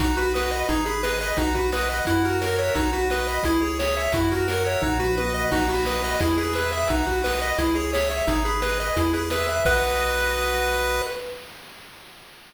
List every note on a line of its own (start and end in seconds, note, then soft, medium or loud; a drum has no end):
0.00 0.64 B1 loud
0.00 0.16 D#4 medium
0.00 0.66 F#4 medium
0.00 kick loud
0.00 closed hi-hat loud
0.17 0.33 F#4 medium
0.17 0.51 B4 medium
0.17 closed hi-hat medium
0.34 0.51 B4 medium
0.34 0.67 D#5 medium
0.34 snare loud
0.51 0.68 B4 medium
0.51 0.67 D#5 medium
0.51 closed hi-hat medium
0.69 1.33 G#1 loud
0.69 0.84 D#4 medium
0.69 1.35 G#4 medium
0.69 kick medium
0.69 closed hi-hat medium
0.86 1.02 G#4 medium
0.86 1.20 B4 medium
0.86 closed hi-hat medium
1.03 1.19 B4 medium
1.03 1.36 D#5 medium
1.03 snare loud
1.21 1.37 B4 medium
1.21 1.37 D#5 medium
1.21 closed hi-hat medium
1.37 2.01 B1 loud
1.37 1.53 D#4 medium
1.37 2.04 F#4 loud
1.37 kick medium
1.37 closed hi-hat medium
1.55 1.71 F#4 medium
1.55 1.89 B4 medium
1.55 kick medium
1.55 closed hi-hat medium
1.72 1.89 B4 medium
1.72 2.05 D#5 medium
1.72 snare loud
1.89 2.06 B4 medium
1.89 2.05 D#5 medium
1.89 closed hi-hat medium
2.05 2.71 F#2 loud
2.05 2.23 E4 medium
2.05 2.72 F#4 medium
2.05 kick medium
2.05 closed hi-hat loud
2.25 2.41 F#4 medium
2.25 2.74 A#4 medium
2.25 closed hi-hat medium
2.41 2.57 A#4 medium
2.41 2.74 C#5 medium
2.41 snare loud
2.59 2.75 C#5 medium
2.59 2.75 E5 medium
2.59 closed hi-hat medium
2.75 3.39 B1 loud
2.75 2.91 D#4 medium
2.75 3.42 F#4 loud
2.75 kick loud
2.75 closed hi-hat loud
2.93 3.08 F#4 medium
2.93 3.28 B4 medium
2.93 closed hi-hat medium
3.10 3.27 B4 medium
3.10 3.43 D#5 medium
3.10 snare loud
3.27 3.45 B4 medium
3.27 3.43 D#5 medium
3.27 closed hi-hat medium
3.43 4.08 C#2 loud
3.43 3.61 E4 medium
3.43 4.10 G#4 loud
3.43 kick medium
3.43 closed hi-hat loud
3.61 3.78 G#4 medium
3.61 3.96 C#5 medium
3.61 closed hi-hat medium
3.79 3.95 C#5 medium
3.79 4.12 E5 medium
3.79 snare loud
3.96 4.13 C#5 medium
3.96 4.13 E5 medium
3.96 closed hi-hat medium
4.12 4.77 F#2 loud
4.12 4.29 E4 medium
4.12 4.80 F#4 medium
4.12 kick loud
4.12 closed hi-hat loud
4.31 4.47 F#4 medium
4.31 4.81 A#4 medium
4.31 kick medium
4.31 closed hi-hat medium
4.48 4.64 A#4 medium
4.48 4.82 C#5 medium
4.48 snare loud
4.65 4.82 C#5 medium
4.65 4.81 E5 medium
4.65 closed hi-hat medium
4.82 5.46 B1 loud
4.82 4.98 D#4 medium
4.82 5.49 F#4 loud
4.82 kick medium
4.82 floor tom medium
4.99 5.16 F#4 medium
4.99 5.34 B4 medium
4.99 mid tom medium
5.17 5.33 B4 medium
5.17 5.50 D#5 medium
5.17 high tom medium
5.34 5.51 B4 medium
5.34 5.50 D#5 medium
5.51 6.16 B1 loud
5.51 5.67 D#4 medium
5.51 6.17 F#4 loud
5.51 kick loud
5.51 crash loud
5.68 5.85 F#4 medium
5.68 6.04 B4 medium
5.68 closed hi-hat medium
5.85 6.02 B4 medium
5.85 6.19 D#5 medium
5.85 snare loud
6.04 6.20 B4 medium
6.04 6.20 D#5 medium
6.04 closed hi-hat medium
6.20 6.84 E2 loud
6.20 6.36 E4 medium
6.20 6.86 G#4 loud
6.20 kick medium
6.20 closed hi-hat loud
6.38 6.53 G#4 medium
6.38 6.72 B4 medium
6.38 closed hi-hat medium
6.53 6.71 B4 medium
6.53 6.88 E5 medium
6.53 snare medium
6.72 6.89 B4 medium
6.72 6.88 E5 medium
6.72 closed hi-hat medium
6.88 7.53 B1 loud
6.88 7.06 D#4 medium
6.88 7.55 F#4 medium
6.88 kick loud
6.88 closed hi-hat loud
7.05 7.22 F#4 medium
7.05 7.41 B4 medium
7.05 kick medium
7.05 closed hi-hat medium
7.24 7.40 B4 medium
7.24 7.57 D#5 medium
7.24 snare loud
7.42 7.58 B4 medium
7.42 7.57 D#5 medium
7.42 closed hi-hat medium
7.58 8.22 C#2 loud
7.58 7.74 E4 medium
7.58 8.24 G#4 medium
7.58 kick medium
7.58 closed hi-hat loud
7.75 7.91 G#4 medium
7.75 8.11 C#5 medium
7.75 closed hi-hat medium
7.93 8.09 C#5 medium
7.93 8.26 E5 medium
7.93 snare loud
8.10 8.27 C#5 medium
8.10 8.26 E5 medium
8.10 closed hi-hat medium
8.27 8.91 G#1 loud
8.27 8.43 D#4 medium
8.27 8.94 G#4 medium
8.27 kick loud
8.27 closed hi-hat loud
8.45 8.61 G#4 medium
8.45 8.79 B4 medium
8.45 closed hi-hat medium
8.62 8.78 B4 medium
8.62 8.95 D#5 medium
8.62 snare loud
8.79 8.96 B4 medium
8.79 8.96 D#5 medium
8.79 closed hi-hat medium
8.96 9.60 E2 loud
8.96 9.12 E4 medium
8.96 9.63 G#4 medium
8.96 kick medium
8.96 closed hi-hat loud
9.13 9.30 G#4 medium
9.13 9.47 B4 medium
9.13 closed hi-hat medium
9.30 9.47 B4 medium
9.30 9.63 E5 medium
9.30 snare loud
9.47 9.64 B4 medium
9.47 9.65 E5 medium
9.47 closed hi-hat medium
9.65 11.02 B1 loud
9.65 11.02 F#4 loud
9.65 11.02 B4 loud
9.65 11.02 D#5 loud
9.65 kick loud
9.65 crash loud